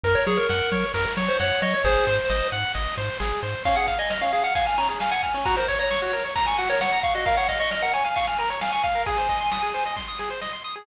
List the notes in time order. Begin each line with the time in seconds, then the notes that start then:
0.03 F#2 A#4, kick, ride
0.15 C#5
0.27 F#3 G#4 C#5, ride
0.37 A#4
0.49 F#2 F#5, snare
0.72 F#3 C#5, kick, ride
0.94 F#2 A#4, kick, ride
1.17 F#3 C#5, ride
1.28 C5
1.39 F#2 C#5 F#5, snare
1.62 F#3 C#5 D#5, ride
1.74 C#5
1.84 G#1 G#4 C5, kick, ride
2.07 G#2 C5, ride
2.30 G#1 D#5, snare
2.52 G#2 F#5, ride
2.75 G#1 D#5, kick, ride
2.97 G#2 C5, ride
3.20 G#1 G#4, snare
3.42 G#2 C5, ride
3.65 C#4 F5, kick, ride
3.76 G#4 F#5
3.88 F5, kick, ride
3.99 D#5 G#5
4.10 D#5 F6, snare
4.21 C#4 F5
4.33 G#4 F5, ride
4.44 F5 F#5
4.55 F5 G#5, kick, ride
4.66 G#5 F6
4.78 C#4 A#5, ride
4.89 G#4
5.00 F5 G#5, snare
5.11 F#5 G#5
5.23 G#5 F6, kick, ride
5.34 C#4
5.45 F#4 A#5, kick, ride
5.57 A#4 C5
5.68 C#5, kick, ride
5.79 C#5 A#5
5.91 C#6, snare
6.02 F#4
6.13 A#4, ride
6.24 C#5
6.36 A#5, kick, ride
6.46 G#5 C#6
6.58 F#4 F#5, ride
6.70 A#4 C#5
6.81 C#5 F#5, snare
6.92 A#5
7.03 F5 C#6, kick, ride
7.15 F#4 D#5
7.26 A#4 F5, kick, ride
7.37 C#5 F#5
7.48 D#5 F5, kick, ride
7.60 D#5 C#6
7.71 D#5 F6, snare
7.82 A#4 F#5
7.93 C#5 G#5, ride
8.05 F5 G#5
8.16 F5 C#6, kick, ride
8.27 G#5 F6
8.38 A#4 A#5, ride
8.50 C#5
8.61 F5 G#5, snare
8.72 G#5 C#6
8.84 F5 F6, kick, ride
8.95 A#4
9.06 G#4 G#5, kick, ride
9.18 C5
9.29 D#5, kick, ride
9.40 C6
9.52 D#6, snare
9.63 G#4
9.74 C5, ride
9.86 D#5
9.96 C6, kick, snare
10.08 D#6
10.19 G#4, snare
10.30 C5
10.41 D#5, snare
10.53 C6
10.64 D#6
10.76 G#4